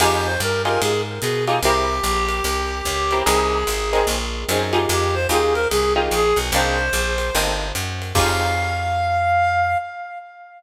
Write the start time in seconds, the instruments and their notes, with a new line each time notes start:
0.00 electric bass (finger) F2, acoustic guitar (steel) D#4 F4 G4 G#4, clarinet G4, kick, crash, ride
0.25 clarinet C5
0.40 electric bass (finger) G2, clarinet A#4, hi-hat pedal, ride
0.65 acoustic guitar (steel) D#4 F4 G4 G#4, clarinet A#4, ride
0.81 electric bass (finger) G#2, clarinet G#4, ride
1.21 electric bass (finger) B2, clarinet G#4, hi-hat pedal, ride
1.47 acoustic guitar (steel) D#4 F4 G4 G#4, ride
1.63 electric bass (finger) C2, acoustic guitar (steel) C4 E4 G4 A#4, clarinet G4, ride
2.03 electric bass (finger) A#1, hi-hat pedal, ride
2.29 ride
2.44 electric bass (finger) C2, ride
2.85 electric bass (finger) C#2, kick, hi-hat pedal, ride
3.11 acoustic guitar (steel) C4 E4 G4 A#4, ride
3.26 electric bass (finger) C2, acoustic guitar (steel) C4 D#4 G#4 A#4, clarinet G#4, ride
3.67 electric bass (finger) G#1, hi-hat pedal, ride
3.93 acoustic guitar (steel) C4 D#4 G#4 A#4, ride
4.07 electric bass (finger) A#1, ride
4.49 electric bass (finger) F#2, acoustic guitar (steel) C4 D#4 G#4 A#4, hi-hat pedal, ride
4.73 acoustic guitar (steel) D#4 F4 G4 G#4, ride
4.89 electric bass (finger) F2, clarinet G4, ride
5.14 clarinet C5
5.29 electric bass (finger) D#2, acoustic guitar (steel) D#4 F4 G4 G#4, clarinet G#4, hi-hat pedal, ride
5.54 clarinet A#4, ride
5.70 electric bass (finger) C2, clarinet G#4, ride
5.96 acoustic guitar (steel) D#4 F4 G4 G#4
6.11 electric bass (finger) A#1, clarinet G#4, hi-hat pedal, ride
6.36 electric bass (finger) B1, ride
6.52 electric bass (finger) C2, acoustic guitar (steel) A#3 C4 D4 D#4, clarinet C5, ride
6.93 electric bass (finger) A#1, hi-hat pedal, ride
7.18 ride
7.35 electric bass (finger) G1, acoustic guitar (steel) A#3 C4 D4 D#4, ride
7.75 electric bass (finger) F#2, hi-hat pedal, ride
8.02 ride
8.15 electric bass (finger) F2, acoustic guitar (steel) D#4 F4 G4 G#4, clarinet F5, kick, crash